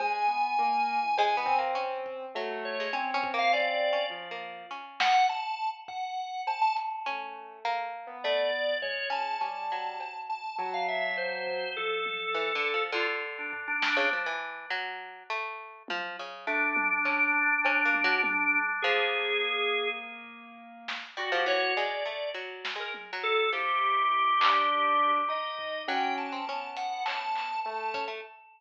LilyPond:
<<
  \new Staff \with { instrumentName = "Drawbar Organ" } { \time 4/4 \tempo 4 = 102 aes''2. r4 | r8 des''8 r8. f''16 d''4 r4 | r8 ges''8 a''8. r16 ges''4 a''16 a''16 r8 | r2 d''4 des''8 a''8 |
a''4. a''8 a''16 f''16 e''8 c''4 | a'2 f'16 r8 d'16 r16 d'8. | r1 | d'1 |
aes'2 r2 | ges'16 g'16 des''8 d''4 r8. bes'16 r8 a'8 | g'2. ees''4 | g''8 a''4 ges''8 a''4 a''8. r16 | }
  \new Staff \with { instrumentName = "Orchestral Harp" } { \time 4/4 r2 \tuplet 3/2 { aes8 b8 bes8 } des'4 | ges8. aes16 \tuplet 3/2 { des'8 des'8 bes8 des'4 des'4 bes4 } | des'1 | des'4 bes4 a8 r4 des'8 |
des'8 ges4. r2 | r4 \tuplet 3/2 { e8 d8 f8 } d4. r16 des16 | f16 e8. ges4 a4 f8 des8 | a4 des'4 \tuplet 3/2 { des'8 bes8 ges8 } r4 |
f1 | g16 f16 e8 aes8 a8 \tuplet 3/2 { ges4 aes4 ges4 } | f1 | ges8. c'16 des'4 des'4. des'16 a16 | }
  \new Staff \with { instrumentName = "Acoustic Grand Piano" } { \time 4/4 aes8 b8 bes8. e8. c'4. | a4 c'2 f4 | r1 | a4. r16 b4~ b16 aes4 |
g4 r4 ges2 | f4. r2 r8 | r1 | r2 aes2 |
bes1 | ges'4 r2. | e'4. d'4. ees'4 | des'4 b2 a4 | }
  \new DrumStaff \with { instrumentName = "Drums" } \drummode { \time 4/4 cb4 r4 cb8 tomfh8 r8 bd8 | r4 r8 bd8 r4 r4 | r8 sn8 r4 bd4 cb8 hh8 | r4 r4 r4 tomfh4 |
r4 cb4 r4 r8 tomfh8 | r8 tommh8 r8 hh8 r4 tomfh8 sn8 | tommh4 r4 r4 tommh4 | r8 tommh8 hc4 cb8 tommh8 tommh4 |
r8 tomfh8 r4 r4 r8 sn8 | r4 r8 tomfh8 r8 sn8 tommh4 | r4 tomfh8 hc8 r4 r8 tomfh8 | r8 hh8 r8 hh8 hc8 hc8 r8 bd8 | }
>>